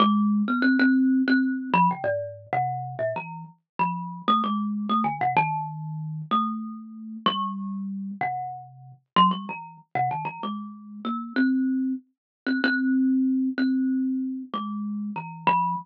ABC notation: X:1
M:5/4
L:1/16
Q:1/4=95
K:none
V:1 name="Kalimba"
_A,3 B, C C3 C3 F, _D, _A,,3 C,3 _B,, | E,2 z2 F,3 A, _A,3 =A, D, C, _E,6 | A,6 G,6 C,5 z _G, =G, | E,2 z C, _E, =E, _A,4 _B,2 C4 z3 C |
C6 C6 _A,4 E,2 F,2 |]